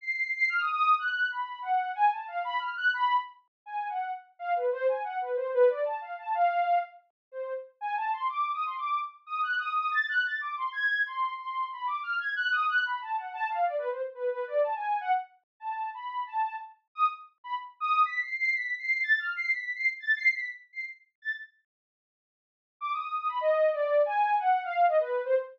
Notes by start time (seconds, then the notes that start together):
0.01 C7
0.36 C7
0.49 F6
0.60 D#6
0.73 D#6
0.99 F#6
1.30 B5
1.62 F#5
1.95 G#5
2.12 A5
2.28 F5
2.45 B5
2.59 F6
2.76 F#6
2.94 B5
3.66 G#5
3.89 F#5
4.39 F5
4.56 B4
4.72 C5
4.88 G#5
5.04 F#5
5.21 B4
5.36 C5
5.54 B4
5.69 D5
5.85 A5
6.01 F5
6.18 A5
6.35 F5
7.32 C5
7.81 G#5
7.96 A5
8.12 C6
8.29 D6
8.54 D#6
8.66 C6
8.78 D6
9.26 D#6
9.43 F#6
9.59 D#6
9.76 D#6
9.91 A6
10.09 F#6
10.25 A6
10.41 D6
10.57 C6
10.73 G#6
11.06 C6
11.38 C6
11.72 B5
11.86 D6
12.03 F6
12.19 G#6
12.36 F#6
12.52 D#6
12.69 F#6
12.85 B5
13.02 A5
13.17 F#5
13.33 A5
13.50 F5
13.65 D5
13.78 B4
13.91 C5
14.15 B4
14.30 B4
14.47 D5
14.64 A5
14.76 G#5
15.01 F#5
15.60 A5
15.94 B5
16.27 A5
16.95 D#6
17.44 B5
17.80 D#6
18.05 B6
18.22 C7
18.37 C7
18.53 B6
18.79 C7
19.03 A6
19.19 F6
19.36 C7
19.51 B6
19.76 C7
20.00 A6
20.17 C7
20.33 B6
20.73 C7
21.22 A6
22.81 D6
22.93 D#6
23.17 D#6
23.29 B5
23.41 D#5
23.73 D5
24.06 G#5
24.39 F#5
24.64 F5
24.88 D#5
25.00 B4
25.25 C5